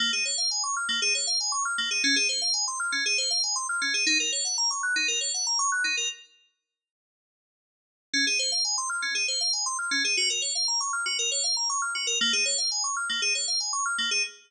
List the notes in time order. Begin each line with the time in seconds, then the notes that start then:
0.00 A#3
0.13 G#4
0.25 C#5
0.38 F5
0.51 G#5
0.63 C#6
0.77 F6
0.89 A#3
1.02 G#4
1.15 C#5
1.27 F5
1.40 G#5
1.52 C#6
1.65 F6
1.78 A#3
1.91 G#4
2.04 C#4
2.16 G#4
2.29 C5
2.42 F5
2.54 G#5
2.68 C6
2.80 F6
2.92 C#4
3.06 G#4
3.18 C5
3.31 F5
3.43 G#5
3.56 C6
3.69 F6
3.82 C#4
3.94 G#4
4.06 D#4
4.20 A#4
4.32 C#5
4.45 F#5
4.58 A#5
4.71 C#6
4.83 F#6
4.96 D#4
5.08 A#4
5.21 C#5
5.34 F#5
5.47 A#5
5.59 C#6
5.72 F#6
5.84 D#4
5.97 A#4
8.14 C#4
8.27 G#4
8.39 C5
8.52 F5
8.65 G#5
8.78 C6
8.90 F6
9.02 C#4
9.15 G#4
9.28 C5
9.41 F5
9.53 G#5
9.66 C6
9.79 F6
9.91 C#4
10.04 G#4
10.17 F#4
10.30 A#4
10.42 C#5
10.55 F5
10.68 A#5
10.81 C#6
10.93 F6
11.06 F#4
11.19 A#4
11.32 C#5
11.44 F5
11.57 A#5
11.70 C#6
11.82 F6
11.95 F#4
12.07 A#4
12.21 A#3
12.33 G#4
12.46 C#5
12.58 F5
12.72 G#5
12.84 C#6
12.97 F6
13.09 A#3
13.22 G#4
13.35 C#5
13.48 F5
13.60 G#5
13.73 C#6
13.86 F6
13.98 A#3
14.11 G#4